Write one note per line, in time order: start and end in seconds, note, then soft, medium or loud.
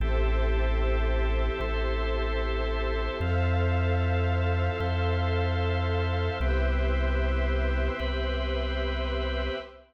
0.00 1.50 A1 medium
0.00 1.60 C4 loud
0.00 1.60 E4 loud
0.00 3.17 G4 medium
0.00 1.60 G4 loud
0.00 3.17 A4 medium
0.00 1.60 A4 medium
0.00 3.17 C5 medium
0.00 3.17 E5 medium
1.60 3.09 A1 medium
1.60 3.19 C4 loud
1.60 3.19 E4 loud
1.60 3.19 A4 loud
1.60 3.19 C5 medium
3.20 4.70 F2 medium
3.20 4.80 C4 loud
3.20 4.80 E4 loud
3.20 4.80 F4 medium
3.20 6.38 A4 medium
3.20 4.80 A4 loud
3.20 6.38 C5 medium
3.20 6.38 E5 medium
3.20 6.38 F5 medium
4.80 6.30 F2 medium
4.80 6.39 C4 medium
4.80 6.39 E4 loud
4.80 6.39 A4 loud
4.80 6.39 C5 medium
6.40 7.90 C2 medium
6.40 7.99 B3 loud
6.40 7.99 C4 loud
6.40 8.00 E4 loud
6.40 9.58 G4 medium
6.40 7.99 G4 loud
6.40 9.58 B4 medium
6.40 9.58 C5 medium
6.40 9.58 E5 medium
8.00 9.50 C2 medium
8.00 9.58 B3 medium
8.00 9.58 C4 loud
8.00 9.58 G4 medium
8.00 9.58 B4 loud